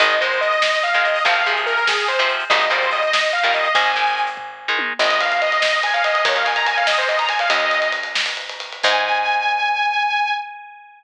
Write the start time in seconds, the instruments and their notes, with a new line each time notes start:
0.00 electric bass (finger) G#1, overdriven guitar D#3 G#3, lead 2 (sawtooth) D#5, kick, closed hi-hat
0.10 closed hi-hat
0.20 overdriven guitar D#3 G#3, lead 2 (sawtooth) C5, closed hi-hat
0.31 closed hi-hat
0.41 lead 2 (sawtooth) D#5, closed hi-hat
0.52 closed hi-hat
0.62 snare
0.73 closed hi-hat
0.83 lead 2 (sawtooth) F5, closed hi-hat
0.93 overdriven guitar D#3 G#3, lead 2 (sawtooth) F5, closed hi-hat
1.04 lead 2 (sawtooth) D#5, closed hi-hat
1.15 open hi-hat
1.25 electric bass (finger) G#1, overdriven guitar C3 F3, lead 2 (sawtooth) F5, kick, closed hi-hat
1.35 closed hi-hat
1.46 overdriven guitar C3 F3, lead 2 (sawtooth) G#4, closed hi-hat
1.57 closed hi-hat
1.66 lead 2 (sawtooth) A#4, closed hi-hat
1.77 closed hi-hat
1.87 lead 2 (sawtooth) G#4, snare
1.98 closed hi-hat
2.08 lead 2 (sawtooth) C5, closed hi-hat
2.19 overdriven guitar C3 F3, closed hi-hat
2.29 closed hi-hat
2.40 closed hi-hat
2.50 electric bass (finger) G#1, overdriven guitar A#2 D#3 G3, lead 2 (sawtooth) D#5, kick, closed hi-hat
2.60 closed hi-hat
2.70 overdriven guitar A#2 D#3 G3, lead 2 (sawtooth) C5, closed hi-hat
2.82 closed hi-hat
2.91 lead 2 (sawtooth) D#5, closed hi-hat
3.02 closed hi-hat
3.13 snare
3.23 closed hi-hat
3.33 lead 2 (sawtooth) F5, closed hi-hat
3.43 overdriven guitar A#2 D#3 G3, lead 2 (sawtooth) F5, closed hi-hat
3.54 lead 2 (sawtooth) D#5, closed hi-hat
3.64 closed hi-hat
3.75 electric bass (finger) G#1, overdriven guitar D#3 G#3, lead 2 (sawtooth) G#5, kick, closed hi-hat
3.86 closed hi-hat
3.96 overdriven guitar D#3 G#3, closed hi-hat
4.06 closed hi-hat
4.17 closed hi-hat
4.27 closed hi-hat
4.37 kick, floor tom
4.68 overdriven guitar D#3 G#3
4.79 high tom
4.99 electric bass (finger) G#1, lead 2 (sawtooth) D#5, crash
5.11 ride
5.20 lead 2 (sawtooth) F5, ride
5.32 ride
5.42 lead 2 (sawtooth) D#5, ride
5.52 ride
5.62 snare
5.73 ride
5.83 lead 2 (sawtooth) G#5, ride
5.94 lead 2 (sawtooth) F5, ride
6.04 lead 2 (sawtooth) D#5, ride
6.15 ride
6.25 electric bass (finger) D#2, lead 2 (sawtooth) C#5, kick, ride
6.36 lead 2 (sawtooth) F5, ride
6.45 lead 2 (sawtooth) G#5, ride
6.56 lead 2 (sawtooth) A#5, ride
6.66 lead 2 (sawtooth) G#5, ride
6.77 lead 2 (sawtooth) F5, ride
6.87 lead 2 (sawtooth) D#5, snare
6.98 lead 2 (sawtooth) C5, ride
7.08 lead 2 (sawtooth) D#5, ride
7.19 lead 2 (sawtooth) A#5, ride
7.29 lead 2 (sawtooth) G#5, ride
7.39 lead 2 (sawtooth) F5, ride
7.50 electric bass (finger) D#2, lead 2 (sawtooth) D#5, ride
7.60 ride
7.71 ride
7.82 ride
7.92 ride
8.03 ride
8.15 snare
8.26 ride
8.37 ride
8.49 ride
8.60 ride
8.72 ride
8.83 electric bass (finger) G#2, lead 2 (sawtooth) G#5, kick, crash